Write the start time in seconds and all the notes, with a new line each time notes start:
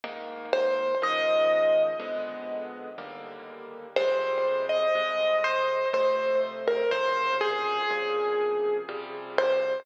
0.04 G#2 D#3 A#3
0.53 C5
1.02 C#2 D#3 F3 G#3 D#5
2.00 F2 D3 G#3 B3
2.98 D#2 D3 G3 A#3
3.96 F2 C3 G3 G#3 C5
4.69 D#5
4.95 F2 C3 G3 G#3
5.44 C5
5.93 F2 C3 A3 C5
6.68 A#4
6.91 A#2 C3 C#3 F3 C5
7.41 G#4
7.90 A#2 C3 C#3 F3
8.89 C3 F3 G3
9.38 C5